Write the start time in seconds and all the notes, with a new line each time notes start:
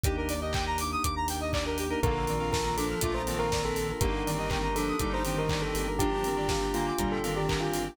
0.04 D#2 A#3 D4 D#4 G4, kick, closed hi-hat
0.17 A#4
0.29 D5, open hi-hat
0.41 A#3 D4 D#4 G4 D#5
0.53 G5, kick, clap
0.66 A#5
0.78 D6, open hi-hat
0.92 D#6
1.03 D#2 D6, kick, closed hi-hat
1.16 A#5
1.28 G5, open hi-hat
1.41 D#5
1.53 D5, kick, clap
1.65 A#3 D4 D#4 G4 A#4
1.78 G4, open hi-hat
1.90 A#3 D4 D#4 G4 A#4
2.03 A#1 D3 A#3 D4 F4 A4 A#4, kick, closed hi-hat
2.15 A#4
2.27 D#3 C4 D5, open hi-hat
2.40 A#3 D4 F4 A4 F5
2.52 A#4 A5, kick, snare
2.65 A#3 D4 F4 A4 A#5
2.77 F3 D4 A4 D6, open hi-hat
2.90 F6
3.01 A#1 A3 A#3 D4 F4 A4 D6, kick, closed hi-hat
3.14 C5 A#5
3.27 D#3 A#3 C4 D4 F4 A4 A5, open hi-hat
3.38 A#4 F5
3.52 A#3 D4 F4 A4 D5, kick, snare
3.65 A4 A#4
3.75 A4, open hi-hat
3.89 A#4
4.01 G1 D3 A#3 D4 D#4 G4 A#4, kick, closed hi-hat
4.13 A#4
4.26 D#3 C4 D5, open hi-hat
4.38 A#3 D4 D#4 G4 D#5
4.50 A#4 G5, kick, clap
4.62 A#3 D4 D#4 G4 A#5
4.75 F3 D4 A4 D6, open hi-hat
4.88 D#6
4.99 G1 G3 A#3 D4 D#4 G4 D6, kick, closed hi-hat
5.12 C5 A#5
5.25 D#3 A#3 C4 D4 D#4 G4 G5, open hi-hat
5.38 A#4 D#5
5.49 A#3 D4 D#4 G4 D5, kick, clap
5.61 A4 A#4
5.75 G1 G4, open hi-hat
5.88 A#4
5.99 F3 A#3 D4 F4 G4, kick, closed hi-hat
6.12 G4
6.24 D#3 C4 A#4, open hi-hat
6.37 A#3 D4 F4 G4 D5
6.49 G4 F5, kick, snare
6.61 A#3 D4 F4 G4 G5
6.74 D3 A#3 F4 A#5, open hi-hat
6.87 D6
6.98 G1 A#2 G3 A#3 D4 F4 G4 A#5, kick, closed hi-hat
7.11 A4 G5
7.23 D#3 A#3 C4 D4 F4 G4 F5, open hi-hat
7.35 G4 D5
7.48 A#3 D4 F4 G4 A#4, kick, clap
7.61 F4 G4
7.72 F4, open hi-hat
7.85 G4